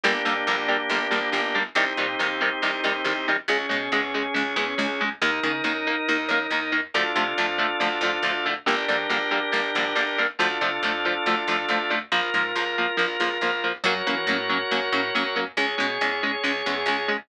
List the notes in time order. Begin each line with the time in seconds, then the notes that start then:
0.04 G1 D3 G3 A#3 D4 G4
0.25 F2 D3 G3 A#3
0.47 A#1 D3 G3 A#3
0.68 D3 G3 A#3
0.89 G1 D3 G3 A#3
1.11 A#1 D3 G3 A#3
1.32 G1 D3 G3 A#3
1.55 D3 G3 A#3
1.75 C2 C3 D#3 G3 C4 D#4 G4
1.97 A#2 C3 D#3 G3
2.19 D#2 C3 D#3 G3
2.41 C3 D#3 G3
2.62 C2 C3 D#3 G3
2.84 D#2 C3 D#3 G3
3.04 C2 C3 D#3 G3
3.28 C3 D#3 G3
3.48 C#2 C#3 G#3 C#4 G#4
3.69 B2 C#3 G#3
3.92 E2 C#3 G#3
4.14 C#3 G#3
4.34 C#2 C#3 G#3
4.56 E2 C#3 G#3
4.78 C#2 C#3 G#3
5.01 C#3 G#3
5.21 D#2 D#3 A#3 D#4 A#4
5.43 C#3 D#3 A#3
5.64 F#2 D#3 A#3
5.87 D#3 A#3
6.08 D#2 D#3 A#3
6.29 F#2 D#3 A#3
6.50 D#2 D#3 A#3
6.72 D#3 A#3
6.94 D2 D3 F3 A3 D4 F4 A4
7.15 C3 D3 F3 A3
7.38 F2 D3 F3 A3
7.58 D3 F3 A3
7.80 D2 D3 F3 A3
8.01 F2 D3 F3 A3
8.23 D2 D3 F3 A3
8.46 D3 F3 A3
8.66 G1 D3 G3 A#3 D4 G4 A#4
8.88 F2 D3 G3 A#3
9.10 A#1 D3 G3 A#3
9.31 D3 G3 A#3
9.52 G1 D3 G3 A#3
9.75 A#1 D3 G3 A#3
9.95 G1 D3 G3 A#3
10.18 D3 G3 A#3
10.39 D2 D3 F3 A3 D4 F4 A4
10.61 C3 D3 F3 A3
10.83 F2 D3 F3 A3
11.05 D3 F3 A3
11.26 D2 D3 F3 A3
11.47 F2 D3 F3 A3
11.69 D2 D3 F3 A3
11.90 D3 F3 A3
12.12 A#1 F3 A#3 F4 A#4
12.34 G#2 F3 A#3
12.55 C#2 F3 A#3
12.78 F3 A#3
12.97 A#1 F3 A#3
13.20 C#2 F3 A#3
13.41 A#1 F3 A#3
13.64 F3 A#3
13.84 F#2 F#3 A#3 C#4 F#4 A#4 C#5
14.07 E3 F#3 A#3 C#4
14.27 A2 F#3 A#3 C#4
14.49 F#3 A#3 C#4
14.71 F#2 F#3 A#3 C#4
14.92 A2 F#3 A#3 C#4
15.15 F#2 F#3 A#3 C#4
15.36 F#3 A#3 C#4
15.57 C#2 G#3 C#4 G#4 C#5
15.78 B2 G#3 C#4
16.01 E2 G#3 C#4
16.23 G#3 C#4
16.43 C#2 G#3 C#4
16.66 E2 G#3 C#4
16.86 C#2 G#3 C#4
17.08 G#3 C#4